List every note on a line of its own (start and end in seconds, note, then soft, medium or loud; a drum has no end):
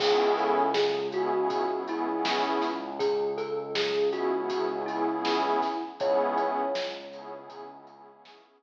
0.00 5.55 C#2 medium
0.00 0.62 B3 medium
0.00 0.62 C#4 medium
0.00 0.62 E4 medium
0.00 0.32 G#4 medium
0.00 0.62 G#4 medium
0.00 kick loud
0.00 crash loud
0.38 0.72 A4 medium
0.38 closed hi-hat medium
0.74 1.06 G#4 medium
0.74 snare loud
1.12 1.30 B3 medium
1.12 1.30 C#4 medium
1.12 1.30 E4 medium
1.12 1.82 F#4 medium
1.12 1.30 G#4 medium
1.12 closed hi-hat medium
1.35 1.63 B3 medium
1.35 1.63 C#4 medium
1.35 1.63 E4 medium
1.35 1.63 G#4 medium
1.50 kick loud
1.50 closed hi-hat loud
1.71 1.83 B3 medium
1.71 1.83 C#4 medium
1.71 1.83 E4 medium
1.71 1.83 G#4 medium
1.87 2.05 B3 medium
1.87 2.05 C#4 medium
1.87 2.05 E4 medium
1.87 2.85 E4 medium
1.87 2.05 G#4 medium
1.87 closed hi-hat medium
2.10 2.68 B3 medium
2.10 2.68 C#4 medium
2.10 2.68 E4 medium
2.10 2.68 G#4 medium
2.25 snare loud
2.62 snare medium
2.62 closed hi-hat medium
2.99 3.36 G#4 medium
2.99 kick loud
2.99 closed hi-hat loud
3.38 3.74 A4 medium
3.38 closed hi-hat medium
3.75 4.10 G#4 medium
3.75 snare loud
4.12 4.29 B3 medium
4.12 4.29 C#4 medium
4.12 4.29 E4 medium
4.12 4.77 F#4 medium
4.12 4.29 G#4 medium
4.12 closed hi-hat medium
4.36 4.65 B3 medium
4.36 4.65 C#4 medium
4.36 4.65 E4 medium
4.36 4.65 G#4 medium
4.50 kick loud
4.50 closed hi-hat loud
4.70 4.83 B3 medium
4.70 4.83 C#4 medium
4.70 4.83 E4 medium
4.70 4.83 G#4 medium
4.86 5.05 B3 medium
4.86 5.05 C#4 medium
4.86 5.82 E4 medium
4.86 5.05 E4 medium
4.86 5.05 G#4 medium
4.86 closed hi-hat medium
5.09 5.66 B3 medium
5.09 5.66 C#4 medium
5.09 5.66 E4 medium
5.09 5.66 G#4 medium
5.25 snare loud
5.62 kick medium
5.62 snare medium
5.62 closed hi-hat medium
5.98 8.63 C#2 medium
5.98 6.61 B3 loud
5.98 6.61 C#4 medium
5.98 6.61 E4 medium
5.98 6.61 G#4 medium
5.98 7.37 C#5 medium
5.98 kick loud
5.98 closed hi-hat loud
6.38 closed hi-hat medium
6.75 snare loud
7.13 7.31 B3 medium
7.13 7.31 C#4 medium
7.13 7.31 E4 medium
7.13 7.31 G#4 medium
7.13 closed hi-hat loud
7.35 7.64 B3 medium
7.35 7.64 C#4 medium
7.35 7.64 E4 medium
7.35 7.64 G#4 medium
7.50 kick loud
7.50 closed hi-hat loud
7.73 7.85 B3 medium
7.73 7.85 C#4 medium
7.73 7.85 E4 medium
7.73 7.85 G#4 medium
7.87 8.07 B3 medium
7.87 8.07 C#4 medium
7.87 8.07 E4 medium
7.87 8.07 G#4 medium
7.87 closed hi-hat medium
8.10 8.63 B3 medium
8.10 8.63 C#4 medium
8.10 8.63 E4 medium
8.10 8.63 G#4 medium
8.25 snare loud